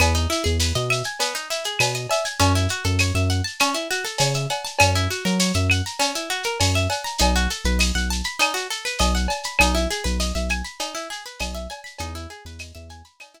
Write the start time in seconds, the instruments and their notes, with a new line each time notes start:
0.00 synth bass 1 E2, acoustic guitar (steel) B3, cowbell, claves, shaker
0.15 acoustic guitar (steel) D#4, shaker
0.30 acoustic guitar (steel) E4, shaker
0.44 synth bass 1 E2, acoustic guitar (steel) G#4, shaker
0.60 acoustic guitar (steel) B4, tambourine, shaker
0.75 synth bass 1 B2, acoustic guitar (steel) D#5, shaker
0.90 acoustic guitar (steel) E5, claves, shaker
1.04 acoustic guitar (steel) G#5, shaker
1.20 acoustic guitar (steel) B3, cowbell, shaker
1.34 acoustic guitar (steel) D#4, shaker
1.50 acoustic guitar (steel) E4, shaker
1.64 acoustic guitar (steel) G#4, shaker
1.79 synth bass 1 B2, acoustic guitar (steel) B4, tambourine, cowbell, claves, shaker
1.95 acoustic guitar (steel) D#5, shaker
2.10 acoustic guitar (steel) E5, cowbell, shaker
2.25 acoustic guitar (steel) G#5, shaker
2.39 synth bass 1 F#2, acoustic guitar (steel) C#4, cowbell, shaker
2.55 acoustic guitar (steel) E4, shaker
2.69 acoustic guitar (steel) F#4, shaker
2.84 synth bass 1 F#2, acoustic guitar (steel) A4, shaker
2.99 acoustic guitar (steel) C#5, tambourine, claves, shaker
3.15 synth bass 1 F#2, acoustic guitar (steel) E5, shaker
3.29 acoustic guitar (steel) F#5, shaker
3.44 acoustic guitar (steel) A5, shaker
3.60 acoustic guitar (steel) C#4, cowbell, claves, shaker
3.74 acoustic guitar (steel) E4, shaker
3.91 acoustic guitar (steel) F#4, shaker
4.04 acoustic guitar (steel) A4, shaker
4.18 synth bass 1 C#3, acoustic guitar (steel) C#5, tambourine, cowbell, shaker
4.34 acoustic guitar (steel) E5, shaker
4.50 acoustic guitar (steel) F#5, cowbell, shaker
4.65 acoustic guitar (steel) A5, shaker
4.79 synth bass 1 F#2, acoustic guitar (steel) C#4, cowbell, claves, shaker
4.95 acoustic guitar (steel) E4, shaker
5.11 acoustic guitar (steel) F#4, shaker
5.25 synth bass 1 F#3, acoustic guitar (steel) A#4, shaker
5.39 acoustic guitar (steel) C#5, tambourine, shaker
5.54 synth bass 1 F#2, acoustic guitar (steel) E5, shaker
5.70 acoustic guitar (steel) F#5, claves, shaker
5.86 acoustic guitar (steel) A#5, shaker
5.99 acoustic guitar (steel) C#4, cowbell, shaker
6.15 acoustic guitar (steel) E4, shaker
6.30 acoustic guitar (steel) F#4, shaker
6.43 acoustic guitar (steel) A#4, shaker
6.60 synth bass 1 F#2, acoustic guitar (steel) C#5, tambourine, cowbell, shaker
6.75 acoustic guitar (steel) E5, shaker
6.90 acoustic guitar (steel) F#5, cowbell, shaker
7.04 acoustic guitar (steel) A#5, shaker
7.18 synth bass 1 B1, acoustic guitar (steel) D#4, cowbell, shaker
7.35 acoustic guitar (steel) F#4, shaker
7.50 acoustic guitar (steel) A4, shaker
7.64 synth bass 1 B1, acoustic guitar (steel) B4, shaker
7.79 acoustic guitar (steel) D#5, tambourine, claves, shaker
7.95 synth bass 1 B1, acoustic guitar (steel) F#5, shaker
8.10 acoustic guitar (steel) A5, shaker
8.24 acoustic guitar (steel) B5, shaker
8.39 acoustic guitar (steel) D#4, cowbell, claves, shaker
8.54 acoustic guitar (steel) F#4, shaker
8.70 acoustic guitar (steel) A4, shaker
8.85 acoustic guitar (steel) B4, shaker
8.99 synth bass 1 B1, acoustic guitar (steel) D#5, tambourine, cowbell, shaker
9.15 acoustic guitar (steel) F#5, shaker
9.28 acoustic guitar (steel) A5, cowbell, shaker
9.43 acoustic guitar (steel) B5, shaker
9.59 synth bass 1 B1, acoustic guitar (steel) D#4, cowbell, claves, shaker
9.75 acoustic guitar (steel) E4, shaker
9.90 acoustic guitar (steel) G#4, shaker
10.04 synth bass 1 B1, acoustic guitar (steel) B4, shaker
10.20 acoustic guitar (steel) D#5, tambourine, shaker
10.35 synth bass 1 B1, acoustic guitar (steel) E5, shaker
10.49 acoustic guitar (steel) G#5, claves, shaker
10.64 acoustic guitar (steel) B5, shaker
10.79 acoustic guitar (steel) D#4, cowbell, shaker
10.95 acoustic guitar (steel) E4, shaker
11.10 acoustic guitar (steel) G#4, shaker
11.26 acoustic guitar (steel) B4, shaker
11.40 synth bass 1 B1, acoustic guitar (steel) D#5, tambourine, cowbell, claves, shaker
11.54 acoustic guitar (steel) E5, shaker
11.70 acoustic guitar (steel) G#5, cowbell, shaker
11.84 acoustic guitar (steel) B5, shaker
11.98 synth bass 1 E2, acoustic guitar (steel) D#4, cowbell, shaker
12.15 acoustic guitar (steel) E4, shaker
12.30 acoustic guitar (steel) G#4, shaker
12.45 synth bass 1 E2, acoustic guitar (steel) B4, shaker
12.59 acoustic guitar (steel) D#5, tambourine, claves, shaker
12.75 synth bass 1 E2, acoustic guitar (steel) E5, shaker
12.89 acoustic guitar (steel) G#5, shaker
13.04 acoustic guitar (steel) B5, shaker
13.20 acoustic guitar (steel) D#4, cowbell, claves, shaker
13.34 acoustic guitar (steel) E4, shaker